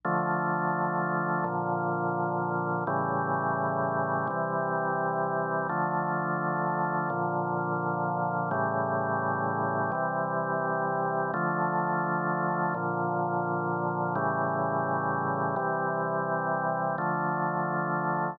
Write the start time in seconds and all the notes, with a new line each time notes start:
0.04 D3 F3 A3
1.44 A#2 D3 F3
2.87 A2 C#3 E3 G3
4.27 C3 E3 G3
5.69 D3 F3 A3
7.10 A#2 D3 F3
8.51 A2 C#3 E3 G3
9.92 C3 E3 G3
11.34 D3 F3 A3
12.74 A#2 D3 F3
14.15 A2 C#3 E3 G3
15.56 C3 E3 G3
16.98 D3 F3 A3